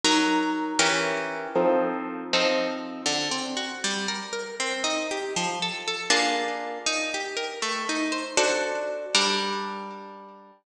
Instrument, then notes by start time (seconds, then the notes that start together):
orchestral harp
0.04 F#3 D#4 A#4
0.79 E3 C#4 G4 A#4
1.56 F3 C4 D#4 A4
2.33 F3 C4 D#4 A4
3.06 D3
3.31 C4
3.57 F#4
3.84 G3
4.08 A#4
4.33 A#4
4.60 C4
4.84 D#4
5.11 G4
5.36 F3
5.62 A4
5.88 A4
6.10 A#3 D4 F4 G#4
6.86 D#4
7.14 G4
7.37 A#4
7.62 A3
7.89 D#4
8.12 C5
8.37 D4 F#4 A4 C5
9.15 G3 D4 A#4